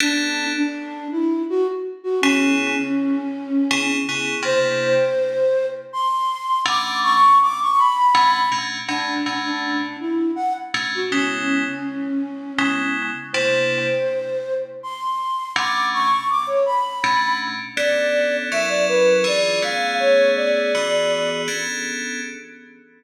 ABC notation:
X:1
M:3/4
L:1/16
Q:1/4=81
K:Bdor
V:1 name="Flute"
D3 D3 E2 F z2 F | C10 z2 | =c8 =c'4 | d'2 c'2 d' c' b4 z2 |
D3 D3 E2 f z2 F | C10 z2 | =c8 =c'4 | d'2 c'2 d' c b4 z2 |
d4 e d B2 d2 =f2 | c2 d6 z4 |]
V:2 name="Electric Piano 2"
[B,CDA]12 | [C,B,EG]8 [C,B,EG]2 [C,B,EG]2 | [=C,_B,DE]12 | [B,,A,CD]8 [B,,A,CD]2 [B,,A,CD]2 |
[B,,A,CD]2 [B,,A,CD]8 [B,,A,CD]2 | [C,G,B,E]8 [C,G,B,E]4 | [=C,_B,DE]12 | [B,,A,CD]8 [B,,A,CD]4 |
[B,CDA]4 [F,CE^A]4 [E,D=FG]2 [=A,B,CG]2- | [A,B,CG]4 [E,B,FG]4 [B,CDA]4 |]